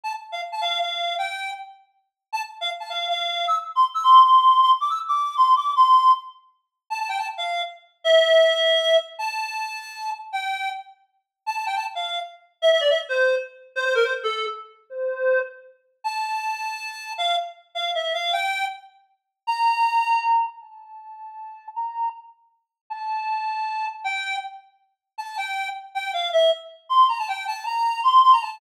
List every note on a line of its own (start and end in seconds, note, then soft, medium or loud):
0.03 0.13 A5 medium
0.32 0.41 F5 medium
0.52 0.61 A5 medium
0.61 0.79 F5 medium
0.80 1.15 F5 medium
1.18 1.51 G5 medium
2.32 2.42 A5 medium
2.61 2.70 F5 medium
2.80 2.89 A5 medium
2.89 3.07 F5 medium
3.09 3.45 F5 medium
3.47 3.56 E6 medium
3.75 3.84 C6 medium
3.94 4.03 E6 medium
4.03 4.21 C6 medium
4.23 4.60 C6 medium
4.61 4.70 C6 medium
4.80 4.89 D6 medium
4.90 4.99 E6 medium
5.08 5.35 D6 medium
5.37 5.53 C6 medium
5.56 5.72 D6 medium
5.76 6.11 C6 medium
6.90 6.98 A5 medium
6.99 7.08 A5 medium
7.09 7.18 G5 medium
7.18 7.27 A5 medium
7.37 7.62 F5 medium
8.04 8.97 E5 medium
9.18 10.10 A5 medium
10.32 10.69 G5 medium
11.46 11.55 A5 medium
11.56 11.65 A5 medium
11.66 11.75 G5 medium
11.76 11.85 A5 medium
11.95 12.19 F5 medium
12.62 12.70 E5 medium
12.71 12.80 E5 medium
12.80 12.89 D5 medium
12.90 12.99 E5 medium
13.09 13.35 C5 medium
13.75 13.84 C5 medium
13.85 13.94 C5 medium
13.95 14.04 A#4 medium
14.04 14.13 C5 medium
14.23 14.46 A4 medium
14.90 15.39 C5 medium
16.04 17.12 A5 medium
17.18 17.36 F5 medium
17.75 17.91 F5 medium
17.95 18.13 E5 medium
18.14 18.32 F5 medium
18.33 18.65 G5 medium
19.47 20.46 A#5 medium
20.61 21.67 A5 medium
21.75 22.09 A#5 medium
22.90 23.86 A5 medium
24.04 24.36 G5 medium
25.18 25.36 A5 medium
25.37 25.68 G5 medium
25.94 26.11 G5 medium
26.13 26.29 F5 medium
26.32 26.50 E5 medium
26.89 27.06 C6 medium
27.08 27.18 A#5 medium
27.18 27.28 A5 medium
27.28 27.45 G5 medium
27.47 27.64 A5 medium
27.66 28.01 A#5 medium
28.03 28.21 C6 medium
28.23 28.32 C6 medium
28.32 28.41 A#5 medium
28.42 28.58 A5 medium